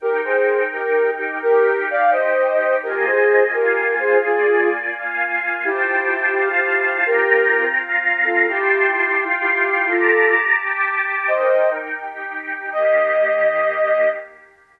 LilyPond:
<<
  \new Staff \with { instrumentName = "Ocarina" } { \time 6/8 \key ees \major \tempo 4. = 85 <g' bes'>8 <aes' c''>4 <g' bes'>4 <ees' g'>8 | <g' bes'>4 <d'' f''>8 <c'' ees''>4. | <g' bes'>8 <aes' c''>4 <g' bes'>4 <aes' c''>8 | <f' aes'>4 r2 |
\key f \major <e' g'>2 <e' g'>4 | <g' bes'>4. r4 <f' a'>8 | <e' g'>2 <e' g'>4 | <f' a'>4 r2 |
\key ees \major <c'' ees''>4 r2 | ees''2. | }
  \new Staff \with { instrumentName = "Pad 2 (warm)" } { \time 6/8 \key ees \major <ees' bes' g''>2. | <ees' g' g''>2. | <bes f' ees'' aes''>4. <bes f' f'' aes''>4. | <bes f' d'' aes''>4. <bes f' f'' aes''>4. |
\key f \major <f' c'' g'' a''>4. <f' c'' f'' a''>4. | <c' f' g'' bes''>4. <c' f' f'' bes''>4. | <f' g'' a'' c'''>4. <f' f'' g'' c'''>4. | <g' a'' bes'' d'''>4. <g' g'' a'' d'''>4. |
\key ees \major <ees' bes' g''>4. <ees' g' g''>4. | <ees bes g'>2. | }
>>